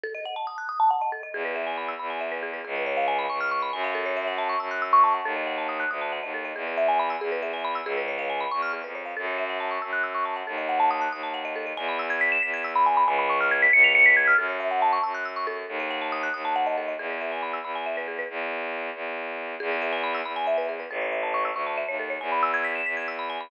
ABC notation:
X:1
M:6/8
L:1/16
Q:3/8=92
K:E
V:1 name="Marimba"
A d f a d' f' d' a f d A d | G B e g b e' b g e B G B | G B c ^e g b c' ^e' c' b g e | A c e f a c' e' f' e' c' a f |
A d f a d' f' d' a f d A d | G B e g b e' G B e g b e' | G B c ^e g b c' ^e' G B c e | A c e f a c' e' f' e' c' a f |
A d f a d' f' d' a f d A d | g b e' g' b' e'' b' g' e' b g b | g b c' ^e' g' b' c'' ^e'' c'' b' g' e' | A c e f a c' e' f' e' c' A2- |
A d f a d' f' d' a f d A d | G B e g b e' b g e B G B | z12 | G B e g b e' b g e B G B |
A c e a c' e' c' a e c A c | g b e' g' b' e'' b' g' e' b g b |]
V:2 name="Violin" clef=bass
z12 | E,,6 E,,6 | C,,6 C,,4 F,,2- | F,,6 F,,6 |
D,,6 =D,,3 ^D,,3 | E,,6 E,,6 | C,,6 E,,3 ^E,,3 | F,,6 F,,6 |
D,,6 D,,6 | E,,6 E,,6 | C,,6 C,,6 | F,,6 F,,6 |
D,,6 D,,6 | E,,6 E,,6 | E,,6 E,,6 | E,,6 E,,6 |
A,,,6 =D,,3 ^D,,3 | E,,6 E,,6 |]